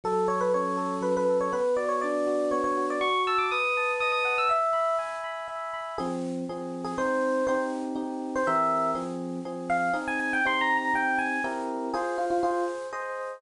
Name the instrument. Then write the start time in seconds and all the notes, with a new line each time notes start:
electric piano 1
0.04 F#3 A4
0.28 A4 C#5
0.41 B4
0.54 C#4 C#5
0.77 A4
1.01 F#3 B4
1.17 B4
1.29 A4
1.41 C#5
1.52 B3 B4
1.77 F#4 D5
1.89 C#5
2.01 D4 D5
2.26 F#4
2.51 B3 C#5
2.64 C#5
2.77 F#4
2.90 D5
3.00 F#4 C#6
3.27 A5 E6
3.38 D6
3.51 B4 D#6
3.77 A5
4.00 D#5 D#6
4.12 D#6
4.25 F#5
4.38 E6
4.49 E5
4.73 B5
4.98 G#5
5.24 B5
5.48 E5
5.73 B5
5.98 F3 C4 G#4
6.49 F3 C4 G#4
6.85 G#4
6.98 G#3 C4 D#4 C5
7.47 C4 D#4 G4 C5
7.95 C4 D#4 G4
8.36 C5
8.47 E3 C4 G4 A#4 E5
8.95 F3 C4 G#4
9.45 F3 C4 G#4
9.70 F5
9.93 C4 D#4 G#4
10.08 G#5
10.20 G#5
10.33 G5
10.45 C4 D#4 G4 C6
10.61 A#5
10.77 A#5
10.94 C4 D#4 G4 G5
11.18 G#5
11.44 C4 E4 G4 A#4
11.94 F4 G#4 C5
12.18 F4
12.30 F4
12.43 F4 G#4 C5
12.93 G#4 C5 D#5